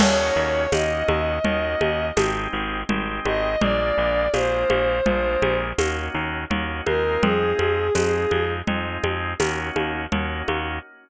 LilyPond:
<<
  \new Staff \with { instrumentName = "Violin" } { \time 5/4 \key ees \dorian \tempo 4 = 83 des''4 ees''2 r4. ees''8 | d''4 c''2 r4. bes'8 | aes'2 r2. | }
  \new Staff \with { instrumentName = "Drawbar Organ" } { \time 5/4 \key ees \dorian <bes des' ees' ges'>4 <bes des' ees' ges'>4 <bes des' ees' ges'>4 <aes c' ees' g'>4 <aes c' ees' g'>4 | <aes bes d' f'>4 <aes bes d' f'>4 <aes bes d' f'>4 <bes des' ees' ges'>4 <bes des' ees' ges'>8 <aes c' ees' f'>8~ | <aes c' ees' f'>4 <aes c' ees' f'>4 <aes c' ees' f'>4 <bes des' ees' ges'>4 <bes des' ees' ges'>4 | }
  \new Staff \with { instrumentName = "Electric Bass (finger)" } { \clef bass \time 5/4 \key ees \dorian ees,8 ees,8 ees,8 ees,8 ees,8 ees,8 aes,,8 aes,,8 aes,,8 aes,,8 | bes,,8 bes,,8 bes,,8 bes,,8 bes,,8 bes,,8 ees,8 ees,8 ees,8 ees,8 | f,8 f,8 f,8 f,8 f,8 f,8 ees,8 ees,8 ees,8 ees,8 | }
  \new DrumStaff \with { instrumentName = "Drums" } \drummode { \time 5/4 <cgl cymc>4 <cgho tamb>8 cgho8 cgl8 cgho8 <cgho tamb>4 cgl8 cgho8 | cgl4 <cgho tamb>8 cgho8 cgl8 cgho8 <cgho tamb>4 cgl8 cgho8 | cgl8 cgho8 <cgho tamb>8 cgho8 cgl8 cgho8 <cgho tamb>8 cgho8 cgl8 cgho8 | }
>>